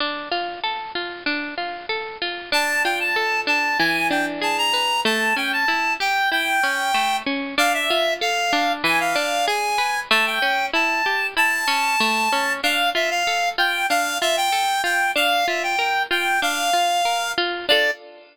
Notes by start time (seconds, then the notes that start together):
0.00 D4
0.31 F4
0.64 A4
0.95 F4
1.26 D4
1.58 F4
1.89 A4
2.22 F4
2.52 D4 A5
2.84 F4 G5
3.00 A5
3.16 A4
3.47 D4 A5
3.79 E3 G#5
4.11 D4 G5
4.41 G#4 A5
4.58 A#5
4.74 B4
5.05 A3 A5
5.36 C#4 G5
5.53 A5
5.68 E4
6.00 G4 G5
6.32 E4 G5
6.63 C#4
6.94 A3
7.26 C#4
7.58 D4 F5
7.74 E5
7.90 F4
8.21 A4 F5
8.53 D4
8.84 E3 G#5
9.00 F5
9.16 D4
9.47 G#4 G#5
9.78 B4
10.11 A3 A5
10.26 G5
10.42 C#4
10.73 E4 A5
11.06 G4
11.37 E4 A5
11.68 C#4
12.00 A3
12.33 C#4
12.63 D4 F5
12.95 F4 E5
13.11 F5
13.27 A4
13.58 F4 G5
13.89 D4 F5
14.21 F4 E5
14.37 G5
14.52 A4
14.84 F4 G5
15.16 D4 F5
15.47 F4 E5
15.63 G5
15.79 A#4
16.11 F4 G5
16.42 D4 F5
16.73 F4
17.05 A#4
17.38 F4
17.68 D4 F4 A4 D5